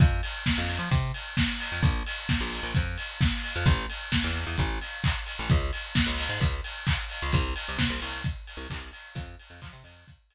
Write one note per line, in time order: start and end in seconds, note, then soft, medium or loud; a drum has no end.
0.00 0.21 F2 medium
0.00 kick loud
0.00 closed hi-hat loud
0.23 open hi-hat medium
0.46 kick medium
0.46 snare loud
0.58 0.79 F2 medium
0.69 open hi-hat medium
0.79 0.89 F3 medium
0.91 1.12 C3 medium
0.91 kick loud
0.91 closed hi-hat medium
1.14 open hi-hat medium
1.37 kick medium
1.37 snare loud
1.60 open hi-hat medium
1.72 1.82 F2 medium
1.82 2.03 A#1 medium
1.82 kick loud
1.82 closed hi-hat medium
2.06 open hi-hat medium
2.29 kick medium
2.29 snare loud
2.41 2.61 A#1 medium
2.52 open hi-hat medium
2.63 2.73 A#1 medium
2.75 2.97 F2 medium
2.75 kick medium
2.75 closed hi-hat loud
2.98 open hi-hat medium
3.21 kick loud
3.21 snare loud
3.44 open hi-hat medium
3.56 3.66 F2 medium
3.66 3.86 A1 medium
3.66 kick loud
3.66 closed hi-hat loud
3.90 open hi-hat medium
4.12 kick medium
4.12 snare loud
4.24 4.45 E2 medium
4.35 open hi-hat medium
4.46 4.57 E2 medium
4.58 4.79 A1 medium
4.58 kick medium
4.58 closed hi-hat loud
4.81 open hi-hat medium
5.04 kick medium
5.04 clap loud
5.27 open hi-hat medium
5.39 5.50 A1 medium
5.50 5.71 C#2 medium
5.50 kick loud
5.50 closed hi-hat loud
5.73 open hi-hat medium
5.95 kick medium
5.95 snare loud
6.07 6.27 C#2 medium
6.18 open hi-hat medium
6.29 6.39 G#2 medium
6.40 6.61 C#2 medium
6.40 kick medium
6.40 closed hi-hat loud
6.64 open hi-hat medium
6.87 kick medium
6.87 clap loud
7.10 open hi-hat medium
7.22 7.33 C#2 medium
7.32 7.54 C2 medium
7.32 kick loud
7.32 closed hi-hat loud
7.56 open hi-hat medium
7.68 7.79 C2 medium
7.78 7.89 C3 medium
7.78 kick medium
7.78 snare loud
7.90 8.00 C2 medium
8.02 8.23 C2 medium
8.02 open hi-hat medium
8.24 kick loud
8.24 closed hi-hat loud
8.47 open hi-hat medium
8.57 8.67 C2 medium
8.70 8.91 C2 medium
8.70 kick medium
8.70 clap loud
8.93 open hi-hat medium
9.15 9.36 F2 medium
9.15 kick loud
9.15 closed hi-hat loud
9.39 open hi-hat medium
9.50 9.60 F2 medium
9.62 9.72 F3 medium
9.62 kick medium
9.62 clap loud
9.73 9.83 C3 medium
9.84 10.04 F2 medium
9.84 open hi-hat medium
10.08 kick medium
10.08 closed hi-hat loud
10.30 open hi-hat medium